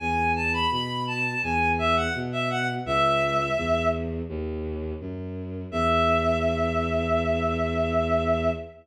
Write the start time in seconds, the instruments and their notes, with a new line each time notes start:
0.00 violin E2, clarinet G#5
0.36 clarinet A5
0.53 clarinet B5
0.71 violin B2, clarinet B5
1.07 clarinet A5
1.43 violin E2, clarinet G#5
1.79 clarinet E5
1.96 clarinet F#5
2.14 violin B2
2.32 clarinet E5
2.50 clarinet F#5
2.85 violin C#2, clarinet E5
3.57 violin E2
4.29 violin D#2
5.00 violin F#2
5.71 violin E2, clarinet E5